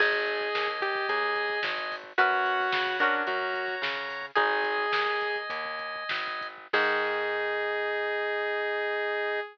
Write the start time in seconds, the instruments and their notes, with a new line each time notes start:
0.00 electric bass (finger) G#1, acoustic guitar (steel) D#4 G#4, lead 2 (sawtooth) G#4, drawbar organ D#5 G#5, kick, crash
0.13 kick
0.26 kick, closed hi-hat
0.41 kick
0.55 electric bass (finger) D#2, kick, snare
0.68 kick
0.81 lead 2 (sawtooth) G4, kick, closed hi-hat
0.95 kick
1.09 electric bass (finger) D#2, lead 2 (sawtooth) G#4, kick, closed hi-hat
1.23 kick
1.36 kick, closed hi-hat
1.50 kick
1.63 electric bass (finger) G#1, kick, snare
1.78 kick
1.92 kick, open hi-hat
2.04 kick
2.18 electric bass (finger) F#2, acoustic guitar (steel) C#4 F#4 B4, lead 2 (sawtooth) F#4, drawbar organ C#5 F#5 B5, kick, closed hi-hat
2.32 kick
2.45 kick, closed hi-hat
2.60 kick
2.72 electric bass (finger) C#3, kick, snare
2.87 kick
2.99 acoustic guitar (steel) C#4 F#4 A#4, lead 2 (sawtooth) D4, kick, closed hi-hat
3.14 kick
3.27 electric bass (finger) F#2, lead 2 (sawtooth) F#4, drawbar organ C#5 F#5 A#5, kick, closed hi-hat
3.41 kick
3.54 kick, closed hi-hat
3.68 kick
3.82 electric bass (finger) C#3, kick, snare
3.97 kick
4.09 kick, open hi-hat
4.22 kick
4.35 electric bass (finger) G#1, acoustic guitar (steel) D#4 G#4, lead 2 (sawtooth) G#4, drawbar organ D#5 G#5, kick, closed hi-hat
4.50 kick
4.64 kick, closed hi-hat
4.78 kick
4.92 electric bass (finger) D#2, kick, snare
5.06 kick
5.21 kick, closed hi-hat
5.36 kick
5.50 electric bass (finger) D#2, kick, closed hi-hat
5.65 kick
5.79 kick, closed hi-hat
5.96 kick
6.09 electric bass (finger) G#1, kick, snare
6.27 kick
6.41 kick, closed hi-hat
6.58 kick
6.73 electric bass (finger) G#2, acoustic guitar (steel) D#3 G#3, drawbar organ D#4 G#4, lead 2 (sawtooth) G#4, kick, crash